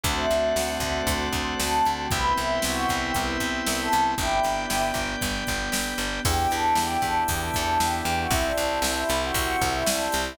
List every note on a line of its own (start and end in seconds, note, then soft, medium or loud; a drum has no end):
0.03 0.26 D2 loud
0.03 2.09 A3 medium
0.03 2.09 C4 medium
0.03 2.09 D4 medium
0.03 2.09 F#4 medium
0.03 2.06 A4 medium
0.03 2.06 C5 medium
0.03 0.16 C5 medium
0.03 2.06 D5 medium
0.03 2.06 F#5 medium
0.03 kick loud
0.03 closed hi-hat loud
0.17 0.54 E5 medium
0.30 0.53 D2 medium
0.30 closed hi-hat medium
0.56 0.78 D2 medium
0.56 0.68 F#5 medium
0.56 snare loud
0.69 0.92 E5 medium
0.80 1.02 D2 medium
0.80 kick medium
0.80 closed hi-hat medium
0.95 1.43 C5 medium
1.07 1.29 D2 medium
1.07 kick medium
1.07 closed hi-hat loud
1.33 1.55 D2 medium
1.33 kick medium
1.33 closed hi-hat medium
1.59 1.82 D2 medium
1.59 1.84 A4 medium
1.59 snare loud
1.85 2.08 D2 medium
1.85 1.98 A4 medium
1.85 closed hi-hat medium
1.98 2.10 G4 medium
2.11 2.33 C2 medium
2.11 4.16 B3 medium
2.11 4.16 C4 medium
2.11 4.16 E4 medium
2.11 4.16 G4 medium
2.11 2.32 B4 medium
2.11 4.15 B4 medium
2.11 4.15 C5 medium
2.11 4.15 E5 medium
2.11 4.15 G5 medium
2.11 kick loud
2.11 closed hi-hat loud
2.37 2.59 C2 medium
2.37 2.59 E4 medium
2.37 closed hi-hat medium
2.62 2.86 C2 medium
2.62 2.85 F#4 medium
2.62 snare loud
2.89 3.12 C2 medium
2.89 kick medium
2.89 closed hi-hat medium
3.02 3.14 G4 medium
3.14 3.38 C2 medium
3.14 3.27 B4 medium
3.14 kick medium
3.14 closed hi-hat loud
3.40 3.62 C2 medium
3.40 kick medium
3.40 closed hi-hat medium
3.66 3.89 C2 medium
3.66 snare loud
3.79 4.00 A4 medium
3.92 4.15 C2 medium
3.92 closed hi-hat medium
4.18 4.40 G1 loud
4.18 6.23 B3 medium
4.18 6.23 D4 medium
4.18 4.82 E4 medium
4.18 4.82 G4 medium
4.18 6.23 G4 soft
4.18 6.21 B4 medium
4.18 6.21 D5 medium
4.18 6.21 G5 medium
4.18 kick loud
4.18 closed hi-hat medium
4.43 4.66 G1 medium
4.43 closed hi-hat medium
4.70 4.92 G1 medium
4.70 snare loud
4.94 5.16 G1 medium
4.94 kick medium
4.94 closed hi-hat medium
5.21 5.44 G1 medium
5.21 kick medium
5.21 closed hi-hat loud
5.47 5.70 G1 medium
5.47 kick medium
5.47 closed hi-hat medium
5.72 5.94 G1 medium
5.72 snare loud
5.98 6.20 G1 medium
5.98 closed hi-hat medium
6.25 6.47 E2 loud
6.25 8.28 B3 medium
6.25 8.28 D4 medium
6.25 8.28 E4 medium
6.25 8.28 G4 medium
6.25 6.48 G4 medium
6.25 kick loud
6.25 crash loud
6.51 6.74 E2 medium
6.51 6.76 A4 medium
6.51 ride medium
6.75 6.97 E2 medium
6.75 6.98 G4 medium
6.75 snare loud
7.02 7.24 E2 medium
7.02 7.15 A4 medium
7.02 kick medium
7.02 ride medium
7.28 7.51 E2 medium
7.28 7.41 G4 medium
7.28 kick loud
7.28 ride loud
7.41 7.78 A4 medium
7.54 7.78 E2 medium
7.54 kick medium
7.54 ride medium
7.80 8.02 E2 medium
7.80 7.93 G4 medium
7.80 snare loud
7.93 8.14 G4 medium
8.05 8.27 E2 medium
8.05 ride medium
8.19 8.31 F#4 medium
8.30 8.52 C2 loud
8.30 10.33 C4 medium
8.30 10.33 E4 medium
8.30 8.44 E4 medium
8.30 10.33 G4 medium
8.30 kick loud
8.30 ride loud
8.45 8.78 D4 medium
8.58 8.80 C2 medium
8.58 ride medium
8.82 9.04 C2 loud
8.82 8.96 D4 medium
8.82 snare loud
8.96 9.20 E4 medium
9.09 9.32 C2 medium
9.09 ride medium
9.23 9.65 F#4 medium
9.34 9.56 C2 medium
9.34 kick medium
9.34 ride loud
9.61 9.83 C2 loud
9.61 kick medium
9.61 ride medium
9.74 9.87 E4 medium
9.86 10.08 C2 medium
9.86 10.12 D4 medium
9.86 snare loud
10.12 10.36 C2 medium
10.12 ride medium
10.26 10.37 E4 medium